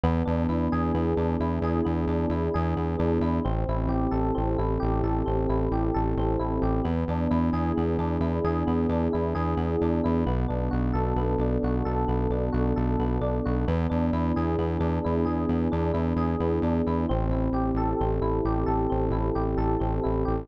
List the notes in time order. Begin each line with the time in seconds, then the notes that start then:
0.04 E2 B3
0.25 E2 D4
0.49 E2 E4
0.72 E2 G#4
0.95 E2 B3
1.17 E2 D4
1.40 E2 E4
1.62 E2 G#4
1.85 E2 B3
2.07 E2 D4
2.30 E2 E4
2.54 E2 G#4
2.77 E2 B3
2.99 E2 D4
3.20 E2 E4
3.45 A1 C4
3.68 A1 E4
3.88 A1 G4
4.11 A1 A4
4.35 A1 C4
4.58 A1 E4
4.80 A1 G4
5.03 A1 A4
5.26 A1 C4
5.49 A1 E4
5.72 A1 G4
5.94 A1 A4
6.17 A1 C4
6.39 A1 E4
6.62 A1 G4
6.84 E2 B3
7.08 E2 D4
7.31 E2 E4
7.53 E2 G#4
7.77 E2 B3
7.99 E2 D4
8.20 E2 E4
8.44 E2 G#4
8.67 E2 B3
8.89 E2 D4
9.13 E2 E4
9.35 E2 G#4
9.57 E2 B3
9.82 E2 D4
10.04 E2 E4
10.26 B1 B3
10.48 B1 D4
10.71 B1 F#4
10.93 B1 A4
11.16 B1 B3
11.38 B1 D4
11.63 B1 F#4
11.85 B1 A4
12.08 B1 B3
12.30 B1 D4
12.52 B1 F#4
12.76 B1 A4
12.99 B1 B3
13.21 B1 D4
13.45 B1 F#4
13.68 E2 B3
13.90 E2 D4
14.13 E2 E4
14.36 E2 G#4
14.58 E2 B3
14.80 E2 D4
15.04 E2 E4
15.25 E2 G#4
15.49 E2 B3
15.72 E2 D4
15.94 E2 E4
16.16 E2 G#4
16.40 E2 B3
16.62 E2 D4
16.87 E2 E4
17.09 A1 C4
17.30 A1 E4
17.53 A1 G4
17.75 A1 A4
18.00 A1 C4
18.21 A1 E4
18.45 A1 G4
18.66 A1 A4
18.90 A1 C4
19.11 A1 E4
19.35 A1 G4
19.57 A1 A4
19.80 A1 C4
20.04 A1 E4
20.25 A1 G4